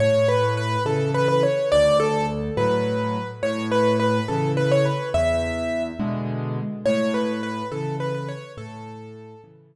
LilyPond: <<
  \new Staff \with { instrumentName = "Acoustic Grand Piano" } { \time 6/8 \key a \major \tempo 4. = 70 cis''8 b'8 b'8 a'8 b'16 b'16 cis''8 | d''8 a'8 r8 b'4. | cis''8 b'8 b'8 a'8 b'16 cis''16 b'8 | e''4. r4. |
cis''8 b'8 b'8 a'8 b'16 b'16 cis''8 | a'4. r4. | }
  \new Staff \with { instrumentName = "Acoustic Grand Piano" } { \clef bass \time 6/8 \key a \major a,4. <cis e>4. | d,4. <a, fis>4. | a,4. <cis e>4. | e,4. <b, d gis>4. |
a,4. <cis e>4. | a,4. <cis e>4. | }
>>